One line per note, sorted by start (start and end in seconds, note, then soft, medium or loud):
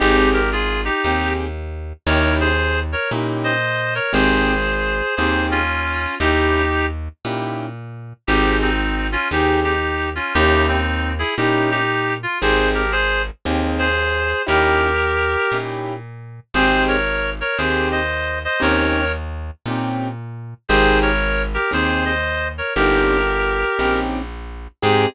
0.00 0.90 G#1 loud
0.00 0.40 C4 medium
0.00 0.30 D#4 loud
0.00 0.40 D#4 medium
0.00 0.30 G4 loud
0.00 0.40 G4 medium
0.00 0.40 G#4 medium
0.33 0.50 G4 medium
0.33 0.50 A#4 medium
0.52 0.81 F4 medium
0.52 0.81 G#4 medium
0.85 1.34 D#4 medium
0.85 1.34 G4 medium
1.04 1.93 D#2 medium
1.04 1.46 C4 medium
1.04 1.46 D#4 medium
1.04 1.46 G4 medium
1.04 1.46 G#4 medium
2.06 2.95 D#2 loud
2.06 2.47 C#4 medium
2.06 2.47 D#4 medium
2.06 2.47 E4 medium
2.06 2.47 G4 medium
2.06 2.35 A#4 medium
2.06 2.35 C#5 medium
2.40 2.79 G#4 medium
2.40 2.79 C5 medium
2.92 3.10 A#4 medium
2.92 3.10 C#5 medium
3.11 4.00 A#2 medium
3.11 3.52 C#4 medium
3.11 3.52 D#4 medium
3.11 3.52 E4 medium
3.11 3.52 G4 medium
3.44 3.94 C5 medium
3.44 3.94 D#5 medium
3.95 4.13 A#4 medium
3.95 4.13 C#5 medium
4.13 5.02 G#1 loud
4.13 4.53 C4 loud
4.13 4.53 D#4 medium
4.13 4.53 G4 medium
4.13 4.53 G#4 medium
4.13 5.15 G#4 medium
4.13 5.15 C5 medium
5.16 6.07 D#2 loud
5.16 5.59 C4 medium
5.16 5.59 D#4 medium
5.16 5.59 G4 medium
5.16 5.46 G#4 medium
5.16 5.59 G#4 medium
5.16 5.46 C5 medium
5.51 6.15 C#4 medium
5.51 6.15 F4 medium
6.20 7.09 D#2 loud
6.20 6.61 C#4 medium
6.20 6.86 D#4 medium
6.20 6.61 D#4 medium
6.20 6.61 E4 medium
6.20 6.86 G4 loud
6.20 6.61 G4 medium
7.25 8.13 A#2 medium
7.25 7.66 C#4 medium
7.25 7.66 D#4 medium
7.25 7.66 E4 medium
7.25 7.66 G4 medium
8.27 9.17 G#1 loud
8.27 8.69 C4 medium
8.27 8.58 D#4 medium
8.27 8.69 D#4 medium
8.27 8.58 G4 loud
8.27 8.69 G4 medium
8.27 8.69 G#4 medium
8.62 9.07 C4 medium
8.62 9.07 D#4 medium
9.12 9.28 C#4 medium
9.12 9.28 F4 medium
9.31 10.20 D#2 medium
9.31 9.73 C4 medium
9.31 9.59 D#4 medium
9.31 9.73 D#4 medium
9.31 9.59 G4 medium
9.31 9.73 G4 medium
9.31 9.73 G#4 medium
9.64 10.09 D#4 medium
9.64 10.09 G4 medium
10.15 10.33 C#4 medium
10.15 10.33 F4 medium
10.34 11.24 D#2 loud
10.34 10.77 C#4 medium
10.34 10.66 D#4 loud
10.34 10.77 D#4 medium
10.34 10.77 E4 medium
10.34 10.66 G4 loud
10.34 10.77 G4 medium
10.68 11.12 C4 medium
10.68 11.12 D#4 medium
11.19 11.35 E4 medium
11.19 11.35 G#4 medium
11.38 12.26 A#2 medium
11.38 11.78 C#4 medium
11.38 11.70 D#4 medium
11.38 11.78 D#4 medium
11.38 11.78 E4 medium
11.38 11.70 G4 medium
11.38 11.78 G4 medium
11.71 12.14 D#4 medium
11.71 12.14 G4 loud
12.23 12.39 F4 medium
12.41 13.31 G#1 loud
12.41 12.82 C4 loud
12.41 12.82 D#4 medium
12.41 12.82 G4 medium
12.41 12.69 G#4 medium
12.41 12.82 G#4 medium
12.41 12.69 C5 medium
12.74 12.92 G4 medium
12.74 12.92 A#4 medium
12.92 13.22 G#4 medium
12.92 13.22 C5 loud
13.45 14.34 D#2 loud
13.45 13.86 C4 medium
13.45 13.86 D#4 medium
13.45 13.86 G4 medium
13.45 13.86 G#4 medium
13.78 14.42 G#4 medium
13.78 14.42 C5 medium
14.47 15.37 D#2 loud
14.47 14.87 C#4 medium
14.47 14.87 D#4 medium
14.47 14.87 E4 medium
14.47 14.87 G4 medium
14.47 15.57 G4 medium
14.47 15.57 A#4 loud
15.52 16.40 A#2 medium
15.52 15.94 C#4 medium
15.52 15.94 D#4 medium
15.52 15.94 E4 medium
15.52 15.94 G4 medium
16.54 17.43 G#1 medium
16.54 16.96 C4 loud
16.54 16.96 D#4 loud
16.54 16.96 G4 medium
16.54 16.84 G#4 medium
16.54 16.96 G#4 medium
16.54 16.84 C5 loud
16.88 17.30 A#4 medium
16.88 17.30 C#5 medium
17.41 17.57 A#4 medium
17.41 17.57 C#5 medium
17.58 18.47 D#2 medium
17.58 17.99 C4 medium
17.58 17.99 D#4 medium
17.58 17.99 G4 medium
17.58 17.88 G#4 medium
17.58 17.99 G#4 medium
17.58 17.88 C5 medium
17.91 18.39 C5 medium
17.91 18.39 D#5 medium
18.45 18.62 C5 medium
18.45 18.62 D#5 medium
18.60 19.51 D#2 loud
18.60 19.01 C4 loud
18.60 19.01 C#4 medium
18.60 19.01 D#4 loud
18.60 19.01 G4 medium
18.60 19.12 A#4 medium
18.60 19.12 C#5 medium
19.66 20.54 A#2 medium
19.66 20.08 C4 medium
19.66 20.08 C#4 medium
19.66 20.08 D#4 medium
19.66 20.08 G4 medium
20.69 21.58 G#1 loud
20.69 21.10 C4 medium
20.69 21.10 D#4 loud
20.69 21.10 G4 medium
20.69 20.99 G#4 medium
20.69 21.10 G#4 medium
20.69 20.99 C5 loud
21.02 21.43 A#4 medium
21.02 21.43 C#5 medium
21.54 21.71 G4 medium
21.54 21.71 A#4 medium
21.71 22.62 D#2 medium
21.71 22.12 C4 medium
21.71 22.12 D#4 medium
21.71 22.12 G4 medium
21.71 22.12 G#4 medium
21.71 22.05 G#4 medium
21.71 22.05 C5 medium
22.05 22.48 C5 medium
22.05 22.48 D#5 medium
22.58 22.73 A#4 medium
22.58 22.73 C#5 medium
22.75 23.65 G1 loud
22.75 23.17 C4 medium
22.75 23.17 C#4 medium
22.75 23.17 D#4 medium
22.75 23.99 G4 medium
22.75 23.17 G4 medium
22.75 23.99 A#4 loud
23.79 24.68 A#1 medium
23.79 24.19 C4 medium
23.79 24.19 C#4 medium
23.79 24.19 D#4 medium
23.79 24.19 G4 medium
24.82 25.06 G#2 loud
24.82 25.06 C4 loud
24.82 25.06 D#4 loud
24.82 25.06 G4 loud
24.82 25.06 G#4 loud